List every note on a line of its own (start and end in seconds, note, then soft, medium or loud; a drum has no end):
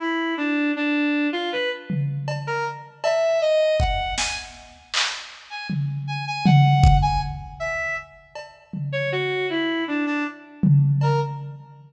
0.00 0.34 E4 medium
0.37 0.71 D4 medium
0.76 1.28 D4 medium
1.33 1.50 F4 loud
1.52 1.69 B4 medium
1.90 floor tom medium
2.28 cowbell medium
2.47 2.64 A#4 loud
3.04 3.38 E5 medium
3.04 cowbell medium
3.42 3.76 D#5 loud
3.80 4.14 F#5 medium
3.80 kick medium
4.18 4.35 G#5 loud
4.18 snare medium
4.94 clap medium
5.50 5.67 G#5 soft
5.70 floor tom medium
6.07 6.25 G#5 medium
6.27 6.44 G#5 medium
6.45 6.97 F#5 medium
6.45 floor tom loud
6.84 kick loud
7.02 7.19 G#5 medium
7.60 7.94 E5 medium
8.35 cowbell medium
8.73 floor tom medium
8.92 9.09 C#5 medium
9.12 9.46 F#4 loud
9.50 9.84 E4 medium
9.88 10.05 D4 medium
10.06 10.24 D4 medium
10.63 floor tom medium
11.01 11.19 A#4 medium
11.01 cowbell medium